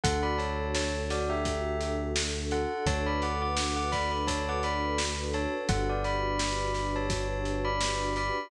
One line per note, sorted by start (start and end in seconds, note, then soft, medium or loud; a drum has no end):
0.04 2.66 D2 loud
0.04 2.81 D4 medium
0.04 2.81 F#4 medium
0.04 2.81 A4 medium
0.04 0.22 A4 loud
0.04 0.22 F#5 loud
0.04 kick medium
0.04 closed hi-hat loud
0.23 0.38 D5 medium
0.23 0.38 B5 medium
0.38 0.71 C#5 medium
0.38 0.71 A5 medium
0.38 closed hi-hat medium
0.75 0.94 C#5 medium
0.75 0.94 A5 loud
0.75 snare medium
1.10 1.29 F#4 medium
1.10 1.29 D5 medium
1.10 snare medium
1.10 closed hi-hat medium
1.30 1.93 G4 medium
1.30 1.93 E5 medium
1.45 kick medium
1.45 closed hi-hat medium
1.81 closed hi-hat medium
2.16 snare medium
2.51 2.84 A4 medium
2.51 2.84 F#5 medium
2.51 closed hi-hat medium
2.86 5.47 D2 loud
2.86 5.63 D4 medium
2.86 5.63 F#4 medium
2.86 5.63 A4 medium
2.86 5.63 B4 medium
2.86 3.05 C#5 loud
2.86 3.05 A5 loud
2.86 kick medium
2.86 closed hi-hat medium
3.06 3.21 D5 medium
3.06 3.21 B5 medium
3.22 3.41 F#5 medium
3.22 3.41 D6 medium
3.22 closed hi-hat medium
3.42 3.76 F#5 medium
3.42 3.76 D6 medium
3.57 snare loud
3.76 3.91 F#5 medium
3.76 3.91 D6 loud
3.92 4.10 D5 medium
3.92 4.10 B5 loud
3.92 kick medium
3.92 snare medium
3.92 closed hi-hat medium
4.11 4.26 D5 medium
4.11 4.26 B5 medium
4.27 4.46 C#5 medium
4.27 4.46 A5 loud
4.27 kick medium
4.27 closed hi-hat loud
4.49 4.64 F#5 medium
4.49 4.64 D6 medium
4.63 4.98 D5 medium
4.63 4.98 B5 medium
4.63 closed hi-hat medium
4.98 snare loud
5.33 5.53 C#5 medium
5.33 5.53 A5 loud
5.33 closed hi-hat medium
5.69 8.31 G1 loud
5.69 8.46 D4 medium
5.69 8.46 F#4 medium
5.69 8.46 G4 medium
5.69 5.87 A4 loud
5.69 8.46 B4 medium
5.69 5.87 F#5 loud
5.69 kick loud
5.69 closed hi-hat medium
5.89 6.05 F#4 medium
5.89 6.04 D5 loud
6.04 6.87 D5 medium
6.04 6.87 B5 loud
6.04 closed hi-hat medium
6.39 snare loud
6.74 snare soft
6.74 closed hi-hat medium
6.96 7.61 C#5 medium
6.96 7.61 A5 medium
7.10 kick medium
7.10 closed hi-hat loud
7.45 closed hi-hat medium
7.65 8.12 D5 medium
7.65 8.12 B5 medium
7.81 snare medium
8.16 8.50 D5 medium
8.16 8.50 B5 medium
8.16 closed hi-hat medium